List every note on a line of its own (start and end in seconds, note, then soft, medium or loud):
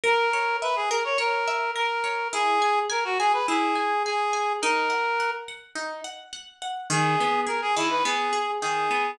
0.04 0.29 A#4 loud
0.04 0.56 A#4 medium
0.33 0.59 C#5 medium
0.62 0.75 B4 medium
0.62 0.88 E5 medium
0.76 0.89 G#4 medium
0.90 1.04 A#4 medium
0.90 1.16 A#4 medium
1.04 1.18 C#5 medium
1.18 1.71 A#4 medium
1.18 1.43 C#5 medium
1.47 1.73 E5 medium
1.75 2.01 A#4 medium
1.75 2.28 A#4 medium
2.03 2.29 C#5 medium
2.33 2.58 E4 loud
2.33 2.79 G#4 medium
2.62 2.87 G#5 medium
2.90 3.04 A#4 medium
2.90 3.15 G#5 medium
3.04 3.18 F#4 medium
3.19 3.33 G#4 medium
3.19 3.45 G#5 loud
3.33 3.46 B4 medium
3.47 3.74 E4 medium
3.47 4.03 G#4 medium
3.75 4.01 G#5 medium
4.05 4.53 G#4 medium
4.05 4.31 G#5 medium
4.33 4.58 G#5 medium
4.62 4.88 D#4 loud
4.62 5.31 A#4 medium
4.89 5.15 F#5 medium
5.19 5.45 F#5 medium
5.48 5.74 F#5 medium
5.75 6.01 D#4 medium
6.04 6.30 F#5 medium
6.33 6.58 F#5 medium
6.62 6.88 F#5 medium
6.90 7.15 D#3 loud
6.90 7.41 G#4 medium
7.20 7.46 B3 medium
7.46 7.72 G#4 medium
7.46 7.61 A#4 medium
7.62 7.75 G#4 medium
7.76 8.02 D#3 medium
7.76 7.90 E4 medium
7.90 8.04 B4 medium
8.04 8.30 B3 medium
8.04 8.51 G#4 medium
8.32 8.58 G#4 medium
8.61 8.87 D#3 medium
8.61 9.11 G#4 medium
8.90 9.16 B3 medium